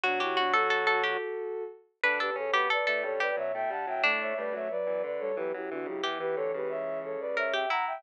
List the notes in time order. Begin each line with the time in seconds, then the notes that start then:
0.03 B2 F#3 D4 F#4
0.20 E4 G4
0.37 D4 F#4
0.53 F#4 A4
0.70 A4
0.87 A4
1.03 G4
2.03 D2 D3 D4 B4
2.19 E2 G4 A4 B4
2.35 F#2 C#3 C#4 A4 C#5
2.53 F#2 B2 B3 G4 B4
2.70 A4 B4 D5
2.87 A2 A3 A4
3.03 F#2 G2 G3 A4 C#5
3.20 E2 G4 B4 D5
3.36 F#2 B2 F#3 C#5 E5
3.54 A2 A3 E5 G5
3.70 G2 G3 F#5 A5
3.87 F#2 A2 F#3 E5 G5
4.03 A2 A3 D4
4.20 C#5 E5
4.37 G2 G3 A3 B4 D5
4.53 F#2 F#3 A3 C#5 E5
4.70 F#3 B4 D5
4.86 E2 E3 F#3
5.03 D2 D3 B4 D5
5.19 G3 A4 C#5
5.36 E2 E3 F#3 G4 B4
5.54 F#2 F#3 E4 G4
5.70 E2 D3 E3 D4 F#4
5.86 C#2 C#3 F#3 E4 G4
6.03 E2 E3 G4
6.20 E2 E3 G4 B4
6.36 D2 D3 A4 C#5
6.54 C#2 C#3 G4 B4
6.69 C#5 E5
7.03 A4 C#5
7.20 B4 D5
7.37 A#4 C#5 E5
7.53 G4 E5 G5
7.69 E4 F#5 A#5
7.87 E5 G5